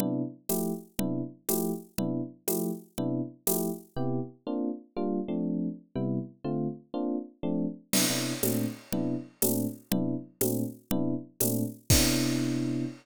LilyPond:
<<
  \new Staff \with { instrumentName = "Electric Piano 1" } { \time 6/8 \key c \mixolydian \tempo 4. = 121 <c b d' e'>4. <f a e' g'>4. | <c b d' e'>4. <f a e' g'>4. | <c b d' e'>4. <f a e' g'>4. | <c b d' e'>4. <f a e' g'>4. |
<c b e' g'>4. <bes c' d' f'>4. | <g bes d' f'>4 <f a c' d'>2 | <c g b e'>4. <d a c' f'>4. | <bes c' d' f'>4. <f a c' d'>4. |
<c b d' e'>8 <c b d' e'>4 <bes, a c' d'>4. | <c b d' e'>4. <bes, a c' d'>4. | <c b d' e'>4. <bes, a c' d'>4. | <c b d' e'>4. <bes, a c' d'>4. |
<c b d' e'>2. | }
  \new DrumStaff \with { instrumentName = "Drums" } \drummode { \time 6/8 cgl4. <cgho tamb>4. | cgl4. <cgho tamb>4. | cgl4. <cgho tamb>4. | cgl4. <cgho tamb>4. |
r4. r4. | r4. r4. | r4. r4. | r4. r4. |
<cgl cymc>4. <cgho tamb>4. | cgl4. <cgho tamb>4. | cgl4. <cgho tamb>4. | cgl4. <cgho tamb>4. |
<cymc bd>4. r4. | }
>>